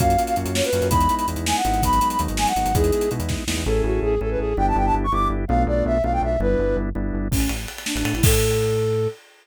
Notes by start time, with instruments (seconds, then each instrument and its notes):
0.00 synth bass 1 F#2, drawbar organ A#3 C#4 F4 F#4, flute F5, kick, closed hi-hat
0.10 closed hi-hat
0.18 drawbar organ A#3 C#4 F4 F#4, closed hi-hat
0.27 flute F5, closed hi-hat
0.36 synth bass 1 F#2, drawbar organ A#3 C#4 F4 F#4, closed hi-hat
0.45 synth bass 1 F#2, closed hi-hat
0.55 flute C#5, snare
0.64 flute B4, closed hi-hat
0.73 synth bass 1 F#2, drawbar organ A#3 C#4 F4 F#4, closed hi-hat
0.82 synth bass 1 F#2, closed hi-hat
0.90 synth bass 1 E2, drawbar organ G#3 B3 D#4 E4, flute B5, kick, closed hi-hat
1.01 closed hi-hat
1.09 drawbar organ G#3 B3 D#4 E4, closed hi-hat
1.18 flute B5, closed hi-hat
1.28 synth bass 1 E2, drawbar organ G#3 B3 D#4 E4, closed hi-hat
1.36 synth bass 1 E2, closed hi-hat
1.46 flute G#5, snare
1.56 flute F#5
1.65 synth bass 1 G#1, drawbar organ G#3 B3 D#4 E4, closed hi-hat
1.74 closed hi-hat
1.83 drawbar organ F#3 G#3 B3 D#4, flute B5, kick, closed hi-hat
1.93 closed hi-hat
2.01 drawbar organ F#3 G#3 B3 D#4, closed hi-hat
2.10 flute B5, closed hi-hat
2.19 synth bass 1 D#2, drawbar organ F#3 G#3 B3 D#4, closed hi-hat
2.28 synth bass 1 G#1, closed hi-hat
2.37 flute G#5, snare
2.47 flute F#5, closed hi-hat
2.56 synth bass 1 G#1, drawbar organ F#3 G#3 B3 D#4, closed hi-hat
2.65 synth bass 1 G#1, closed hi-hat
2.74 synth bass 1 E2, drawbar organ G#3 B3 D#4 E4, flute G#4, kick, closed hi-hat
2.84 closed hi-hat
2.92 drawbar organ G#3 B3 D#4 E4, closed hi-hat
3.01 closed hi-hat
3.11 synth bass 1 B2, drawbar organ G#3 B3 D#4 E4, closed hi-hat
3.20 synth bass 1 E2, closed hi-hat
3.29 kick, snare
3.47 synth bass 1 E2, drawbar organ G#3 B3 D#4 E4, snare
3.57 synth bass 1 E2
3.66 synth bass 1 A1, drawbar organ C#4 E4 G#4 A4, flute A4
3.84 synth bass 1 A1, flute F#4
4.03 synth bass 1 A1, flute G#4
4.21 synth bass 1 A1, drawbar organ C#4 E4 G#4 A4, flute A4
4.31 flute B4
4.39 synth bass 1 A1, flute G#4
4.57 synth bass 1 G1, drawbar organ B3 D4 E4 G4, flute G5
4.68 flute A5
4.76 synth bass 1 G1, flute G5
4.86 flute A5
4.94 synth bass 1 G1
5.04 flute C#6
5.12 synth bass 1 G1, drawbar organ B3 D4 E4 G4, flute D6
5.30 synth bass 1 G1
5.48 synth bass 1 B1, drawbar organ A3 B3 D4 F4, flute F5
5.67 synth bass 1 B1, flute D5
5.85 synth bass 1 B1, flute E5
6.04 synth bass 1 B1, drawbar organ A3 B3 D4 F4, flute F5
6.13 flute G5
6.22 synth bass 1 B1, flute E5
6.40 synth bass 1 G1, drawbar organ G3 B3 D4 E4, flute B4
6.59 synth bass 1 G1
6.77 synth bass 1 G1
6.95 synth bass 1 G1, drawbar organ G3 B3 D4 E4
7.13 synth bass 1 G1
7.31 synth bass 1 A1, flute C#4, kick, crash
7.40 ride
7.49 synth bass 1 A1, ride
7.68 ride
7.78 ride
7.86 flute D4, snare
7.95 synth bass 1 A1, flute D4, ride
8.05 synth bass 1 A2, ride
8.13 synth bass 1 A1, flute E4, ride
8.23 synth bass 1 A2, flute A4, kick, crash